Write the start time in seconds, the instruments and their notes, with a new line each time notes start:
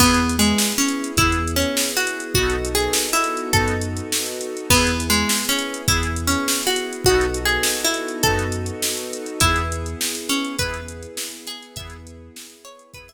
0.00 synth bass 2 E2, accordion B3 E4 G#4, harpsichord B3, string ensemble 1 B3 E4 G#4, kick, crash
0.14 closed hi-hat
0.29 closed hi-hat
0.39 harpsichord G#3
0.45 closed hi-hat
0.58 snare
0.72 closed hi-hat
0.78 harpsichord C#4
0.88 closed hi-hat
1.04 closed hi-hat
1.17 synth bass 2 E2, accordion B3 E4, harpsichord E4, kick, closed hi-hat
1.22 accordion G#4
1.32 closed hi-hat
1.47 closed hi-hat
1.56 harpsichord C#4
1.62 closed hi-hat
1.77 snare
1.91 closed hi-hat
1.97 harpsichord F#4
2.07 closed hi-hat
2.20 closed hi-hat
2.34 synth bass 2 B1, accordion B3 D#4 F#4, string ensemble 1 B3 D#4 F#4 A4, harpsichord F#4, kick
2.40 accordion A4
2.50 closed hi-hat
2.65 closed hi-hat
2.75 harpsichord G#4
2.80 closed hi-hat
2.93 snare
3.09 closed hi-hat
3.13 harpsichord E4
3.24 closed hi-hat
3.37 closed hi-hat
3.53 synth bass 2 F#2, accordion B3 D#4 F#4, harpsichord A4, kick, closed hi-hat
3.58 accordion A4
3.68 closed hi-hat
3.81 closed hi-hat
3.97 closed hi-hat
4.12 snare
4.26 closed hi-hat
4.41 closed hi-hat
4.57 closed hi-hat
4.70 synth bass 2 E2, harpsichord B3, accordion B3 E4 G#4, string ensemble 1 B3 E4 G#4, kick, crash
4.87 closed hi-hat
5.00 closed hi-hat
5.10 harpsichord G#3
5.14 closed hi-hat
5.29 snare
5.45 harpsichord C#4, closed hi-hat
5.59 closed hi-hat
5.74 closed hi-hat
5.87 synth bass 2 E2, accordion B3 E4 G#4, harpsichord E4, kick, closed hi-hat
6.03 closed hi-hat
6.16 closed hi-hat
6.27 harpsichord C#4
6.32 closed hi-hat
6.48 snare
6.63 harpsichord F#4, closed hi-hat
6.76 closed hi-hat
6.93 closed hi-hat
7.04 synth bass 2 B1, accordion B3 D#4, string ensemble 1 B3 D#4 F#4 A4, harpsichord F#4, kick
7.09 accordion F#4 A4
7.21 closed hi-hat
7.34 closed hi-hat
7.45 harpsichord G#4, closed hi-hat
7.63 snare
7.80 closed hi-hat
7.84 harpsichord E4
7.94 closed hi-hat
8.08 closed hi-hat
8.23 synth bass 2 F#2, accordion B3 D#4, harpsichord A4, kick, closed hi-hat
8.28 accordion F#4 A4
8.39 closed hi-hat
8.52 closed hi-hat
8.66 closed hi-hat
8.82 snare
8.97 closed hi-hat
9.13 closed hi-hat
9.26 closed hi-hat
9.40 synth bass 2 E2, string ensemble 1 B3 E4 G#4, accordion B3 E4, harpsichord E4, kick, closed hi-hat
9.45 accordion G#4
9.56 closed hi-hat
9.72 closed hi-hat
9.86 closed hi-hat
10.01 snare
10.15 closed hi-hat
10.29 harpsichord C#4, closed hi-hat
10.44 closed hi-hat
10.59 synth bass 2 E2, accordion B3 E4, harpsichord B4, kick, closed hi-hat
10.63 accordion G#4
10.74 closed hi-hat
10.88 closed hi-hat
11.03 closed hi-hat
11.17 snare
11.32 closed hi-hat
11.47 harpsichord G#4, closed hi-hat
11.63 closed hi-hat
11.76 synth bass 2 E2, accordion B3 E4 G#4, string ensemble 1 B3 E4 G#4, harpsichord E5, kick, closed hi-hat
11.90 closed hi-hat
12.07 closed hi-hat
12.36 snare, closed hi-hat
12.50 closed hi-hat
12.65 harpsichord C#5, closed hi-hat
12.79 closed hi-hat
12.94 synth bass 2 E2, accordion B3 E4, harpsichord B4, kick, closed hi-hat
12.98 accordion G#4
13.08 harpsichord E5, closed hi-hat